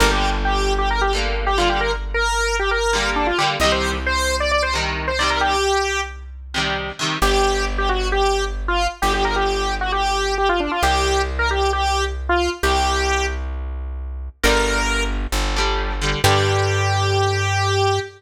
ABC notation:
X:1
M:4/4
L:1/16
Q:1/4=133
K:Gm
V:1 name="Lead 1 (square)"
B G2 z G3 G B G z3 G F G | B z2 B4 G B4 D F G z | e c2 z c3 d d c z3 c d B | G6 z10 |
G4 z G ^F2 G3 z2 =F2 z | G G B G4 ^F G4 G =F D F | G4 z B G2 G3 z2 F2 z | G6 z10 |
B6 z10 | G16 |]
V:2 name="Acoustic Guitar (steel)"
[D,G,B,]10 [D,G,B,]4 [D,G,B,]2- | [D,G,B,]10 [D,G,B,]4 [D,G,B,]2 | [C,E,G,]10 [C,E,G,]4 [C,E,G,]2- | [C,E,G,]10 [C,E,G,]4 [C,E,G,]2 |
z16 | z16 | z16 | z16 |
[D,G,]10 [D,G,]4 [D,G,]2 | [D,G,]16 |]
V:3 name="Electric Bass (finger)" clef=bass
G,,,16- | G,,,16 | C,,16- | C,,16 |
G,,,16 | G,,,16 | C,,16 | C,,16 |
G,,,8 G,,,8 | G,,16 |]